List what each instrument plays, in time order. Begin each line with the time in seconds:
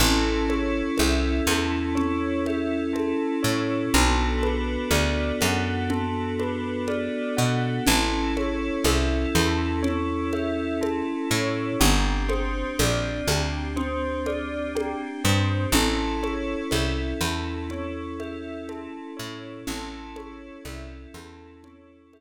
0.00 electric bass (finger) A1, pad 5 (bowed) C#4 E4 A4, tubular bells A4, low conga
0.49 tubular bells C#5, high conga
0.98 electric bass (finger) C2, tubular bells E5, high conga
1.47 electric bass (finger) E2, tubular bells A4, high conga
1.95 tubular bells C#5, low conga
2.46 tubular bells E5, high conga
2.93 tubular bells A4, high conga
3.43 electric bass (finger) A2, tubular bells C#5
3.94 electric bass (finger) B1, pad 5 (bowed) B3 D4 F#4 A4, tubular bells A4, low conga
4.43 tubular bells B4, high conga
4.91 electric bass (finger) D2, tubular bells D5, high conga
5.41 electric bass (finger) F#2, tubular bells F#5, high conga
5.90 tubular bells A4, low conga
6.39 tubular bells B4, high conga
6.88 tubular bells D5, high conga
7.37 electric bass (finger) B2, tubular bells F#5
7.86 electric bass (finger) A1, pad 5 (bowed) C#4 E4 A4, tubular bells A4, low conga
8.37 tubular bells C#5, high conga
8.84 electric bass (finger) C2, tubular bells E5, high conga
9.35 electric bass (finger) E2, tubular bells A4, high conga
9.83 tubular bells C#5, low conga
10.33 tubular bells E5, high conga
10.81 tubular bells A4, high conga
11.31 electric bass (finger) A2, tubular bells C#5
11.80 electric bass (finger) G1, pad 5 (bowed) C4 D4 G4, tubular bells G4, low conga
12.29 tubular bells C5, high conga
12.79 electric bass (finger) A#1, tubular bells D5, high conga
13.27 electric bass (finger) D2, tubular bells G4, high conga
13.76 tubular bells C5, low conga
14.26 tubular bells D5, high conga
14.75 tubular bells G4, high conga
15.24 electric bass (finger) G2, tubular bells C5
15.72 electric bass (finger) A1, pad 5 (bowed) C#4 E4 A4, tubular bells A4, low conga
16.23 tubular bells C#5, high conga
16.71 electric bass (finger) C2, tubular bells E5, high conga
17.21 electric bass (finger) E2, tubular bells A4, high conga
17.70 tubular bells C#5, low conga
18.20 tubular bells E5, high conga
18.69 tubular bells A4, high conga
19.17 electric bass (finger) A2, tubular bells C#5
19.67 electric bass (finger) A1, pad 5 (bowed) C#4 E4 A4, tubular bells A4, low conga
20.16 tubular bells C#5, high conga
20.65 electric bass (finger) C2, tubular bells E5, high conga
21.14 electric bass (finger) E2, tubular bells A4, high conga
21.64 tubular bells C#5, low conga
22.13 tubular bells E5, high conga